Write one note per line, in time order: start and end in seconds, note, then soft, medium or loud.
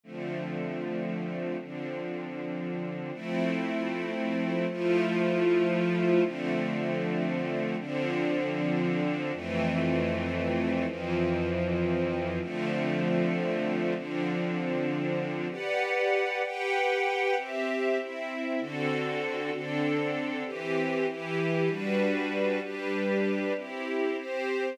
0.03 1.57 D3 medium
0.03 1.57 F3 medium
0.03 1.57 A3 medium
0.03 1.57 C4 medium
1.59 3.12 D3 medium
1.59 3.12 F3 medium
1.59 3.12 C4 medium
1.59 3.12 D4 medium
3.13 4.66 F3 medium
3.13 4.66 A3 medium
3.13 4.66 C4 loud
3.13 4.66 E4 medium
4.69 6.22 F3 loud
4.69 6.22 A3 loud
4.69 6.23 E4 medium
4.69 6.23 F4 medium
6.22 7.75 D3 medium
6.22 7.75 F3 medium
6.22 7.75 A3 medium
6.22 7.75 C4 medium
7.79 9.32 D3 loud
7.79 9.32 F3 medium
7.79 9.32 C4 medium
7.79 9.32 D4 medium
9.32 10.85 F2 medium
9.32 10.85 E3 medium
9.32 10.86 A3 medium
9.32 10.85 C4 loud
10.86 12.39 F2 medium
10.86 12.39 E3 medium
10.86 12.39 F3 medium
10.86 12.39 C4 medium
12.40 13.93 D3 medium
12.40 13.93 F3 medium
12.40 13.93 A3 medium
12.40 13.93 C4 medium
13.94 15.48 D3 medium
13.94 15.48 F3 medium
13.94 15.48 C4 medium
13.94 15.48 D4 medium
15.50 16.42 G4 medium
15.50 16.42 B4 medium
15.50 16.42 D5 medium
15.50 16.42 F#5 medium
16.43 17.35 G4 medium
16.43 17.35 B4 medium
16.43 17.35 F#5 medium
16.43 17.35 G5 loud
17.37 17.98 C4 medium
17.37 17.98 G4 medium
17.37 17.98 E5 medium
17.98 18.59 C4 medium
17.98 18.60 E4 medium
17.98 18.60 E5 medium
18.60 19.51 D3 medium
18.60 19.51 C4 medium
18.60 19.52 F#4 medium
18.60 19.51 A4 medium
19.51 20.43 D3 medium
19.51 20.43 C4 medium
19.51 20.43 D4 medium
19.51 20.43 A4 medium
20.45 21.06 E3 loud
20.45 21.06 C4 medium
20.45 21.06 G4 loud
21.08 21.69 E3 loud
21.08 21.69 E4 medium
21.08 21.69 G4 loud
21.68 22.59 G3 loud
21.68 22.59 D4 medium
21.68 22.59 F#4 medium
21.68 22.59 B4 medium
22.61 23.53 G3 medium
22.61 23.53 D4 medium
22.61 23.53 G4 medium
22.61 23.53 B4 medium
23.56 24.17 C4 medium
23.56 24.17 E4 medium
23.56 24.17 G4 medium
24.18 24.78 C4 medium
24.18 24.78 G4 medium
24.18 24.78 C5 medium